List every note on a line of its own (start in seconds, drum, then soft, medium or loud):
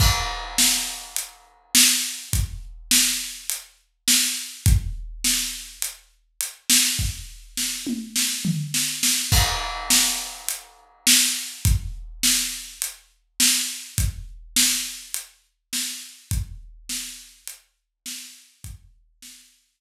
0.00 kick medium
0.00 crash medium
0.58 snare loud
1.16 closed hi-hat medium
1.75 snare loud
2.33 kick medium
2.33 closed hi-hat medium
2.91 snare loud
3.50 closed hi-hat loud
4.08 snare loud
4.66 kick loud
4.66 closed hi-hat medium
5.24 snare medium
5.82 closed hi-hat medium
6.41 closed hi-hat medium
6.70 snare loud
6.99 kick medium
7.57 snare medium
7.87 mid tom medium
8.16 snare medium
8.45 floor tom medium
8.74 snare medium
9.03 snare medium
9.32 kick medium
9.32 crash loud
9.90 snare loud
10.49 closed hi-hat medium
11.07 snare loud
11.65 kick loud
11.65 closed hi-hat medium
12.23 snare medium
12.82 closed hi-hat medium
13.40 snare loud
13.98 kick medium
13.98 closed hi-hat medium
14.56 snare loud
15.14 closed hi-hat medium
15.73 snare medium
16.31 kick loud
16.31 closed hi-hat medium
16.89 snare medium
17.47 closed hi-hat medium
18.06 snare loud
18.64 kick medium
18.64 closed hi-hat medium
19.22 snare medium